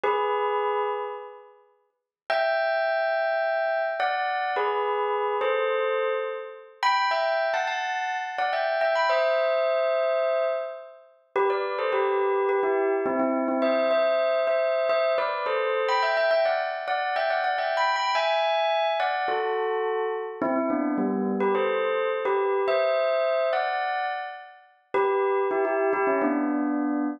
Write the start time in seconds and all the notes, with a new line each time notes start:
0.03 G#4 B4
2.30 E5 G5
4.00 D5 F#5
4.56 G#4 B4
5.41 A4 C5
6.83 G5 B5
7.11 E5 G5
7.54 F#5 A5
7.67 F#5 A5
8.38 D5 F#5
8.53 E5 G5
8.81 E5 G5
8.95 G5 B5
9.09 C5 E5
11.36 G4 B4
11.50 B4 D5
11.78 A4 C5
11.92 G4 B4
12.49 G4 B4
12.63 E4 G4
13.06 C4 E4
13.19 C4 E4
13.48 C4 E4
13.62 C5 E5
13.91 C5 E5
14.47 C5 E5
14.89 C5 E5
15.18 B4 D5
15.46 A4 C5
15.88 G5 B5
16.02 E5 G5
16.17 E5 G5
16.31 E5 G5
16.45 D5 F#5
16.88 D5 F#5
17.16 E5 G5
17.30 D5 F#5
17.44 D5 F#5
17.58 E5 G5
17.77 G5 B5
17.96 G5 B5
18.15 E5 G#5
19.00 D5 F#5
19.28 F#4 A4
20.42 C4 E4
20.56 C4 E4
20.70 B3 D4
20.98 G3 B3
21.40 G4 B4
21.55 A4 C5
22.25 G4 B4
22.68 C5 E5
23.53 D5 F#5
24.94 G4 B4
25.51 E4 G4
25.65 E4 G4
25.93 E4 G4
26.07 C#4 E4
26.22 B3 D4